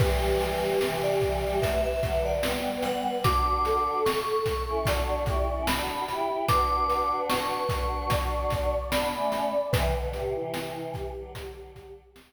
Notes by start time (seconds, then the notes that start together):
0.00 E3 G3 G4 B4, kick, crash
0.41 closed hi-hat
0.81 C3 E3 B4, snare
1.03 D5
1.21 C3 E3, kick, closed hi-hat
1.44 E3 G3
1.61 F#3 A3 B4 E5, kick, closed hi-hat
1.84 E5
2.02 D3 F#3, kick, closed hi-hat
2.25 D5
2.43 G3 B3, snare
2.82 F#5, closed hi-hat
3.24 D4 F#4 D6, kick, closed hi-hat
3.65 A4, closed hi-hat
4.06 C#6, snare
4.46 kick, closed hi-hat
4.68 C#4 E4
4.85 D4 F#4 D5, kick, closed hi-hat
5.26 E4 G4, kick, closed hi-hat
5.49 C#4 E4
5.67 D4 F#4 B5, snare
6.08 E4 G4, closed hi-hat
6.48 D4 F#4 B4 D6, kick, closed hi-hat
6.90 closed hi-hat
7.29 C#6, snare
7.69 D4 F#4, kick, closed hi-hat
8.10 D5, kick, closed hi-hat
8.50 kick, snare, closed hi-hat
8.92 B3 D4 B5, snare
9.15 A3 C#4
9.32 closed hi-hat
9.72 C3 E3 B4, kick, closed hi-hat
9.95 B2 D3
10.13 A2 C3 G4, closed hi-hat
10.35 C3 E3 E4
10.53 E4, snare
10.94 G4, kick, snare, closed hi-hat
11.15 D3 F#3
11.35 kick, closed hi-hat
11.76 kick, closed hi-hat
12.16 snare